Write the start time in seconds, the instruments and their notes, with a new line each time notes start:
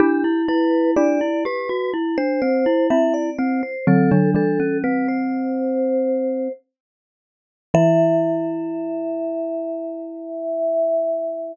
0.00 glockenspiel D4, xylophone E4 G4, vibraphone G4
0.24 glockenspiel E4
0.48 glockenspiel E4, vibraphone B4
0.96 glockenspiel D4, xylophone E4 G4, vibraphone D5
1.21 glockenspiel E4
1.45 glockenspiel G4, vibraphone B4
1.69 glockenspiel F#4
1.94 glockenspiel E4
2.18 glockenspiel D4, vibraphone C5
2.42 glockenspiel C4, vibraphone C5
2.66 glockenspiel E4
2.90 xylophone C4 E4, glockenspiel E4, vibraphone E5
3.14 vibraphone D5
3.39 glockenspiel C4, vibraphone C5
3.63 vibraphone C5
3.87 xylophone D3 F#3, glockenspiel C4, vibraphone A4
4.11 xylophone D3 F#3, glockenspiel D4
4.34 xylophone E3 G3, glockenspiel D4, vibraphone A4
4.60 glockenspiel C#4
4.84 glockenspiel C4, vibraphone B4
5.08 vibraphone C5
7.74 xylophone E3, glockenspiel E4, vibraphone E5